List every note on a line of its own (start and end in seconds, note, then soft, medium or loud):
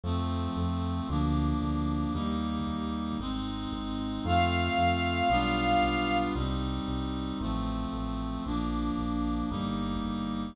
0.04 0.48 F2 loud
0.04 1.08 F3 medium
0.04 1.08 A3 medium
0.04 1.08 C4 medium
0.56 1.01 F2 loud
1.09 1.54 D2 loud
1.09 2.13 F3 medium
1.09 2.13 A#3 medium
1.09 2.13 D4 medium
1.61 2.06 D2 medium
2.13 2.59 D#2 loud
2.13 3.18 G3 medium
2.13 3.18 A#3 medium
2.13 3.18 D#4 medium
2.67 3.12 D#2 medium
3.20 3.64 G#1 loud
3.20 4.24 G#3 medium
3.20 4.24 C4 medium
3.20 4.24 D#4 medium
3.72 4.17 G#1 loud
4.25 4.70 F2 loud
4.25 5.29 A3 medium
4.25 5.29 C4 medium
4.25 5.29 F4 medium
4.25 6.16 F5 medium
4.77 5.22 F2 medium
5.30 5.75 B1 loud
5.30 6.34 G3 medium
5.30 6.34 B3 medium
5.30 6.34 D4 medium
5.30 6.34 F4 medium
5.83 6.28 B1 medium
6.35 6.80 C2 loud
6.35 7.39 G3 medium
6.35 7.39 C4 medium
6.35 7.39 D#4 medium
6.88 7.33 C2 medium
7.40 7.85 A1 loud
7.40 8.44 F3 medium
7.40 8.44 A3 medium
7.40 8.44 C4 medium
7.93 8.38 A1 medium
8.45 8.91 A#1 loud
8.45 9.49 F3 medium
8.45 9.49 A#3 medium
8.45 9.49 D4 medium
8.99 9.43 A#1 medium
9.50 9.96 G1 loud
9.50 10.54 G3 medium
9.50 10.54 A#3 medium
9.50 10.54 D#4 medium
10.04 10.48 G1 medium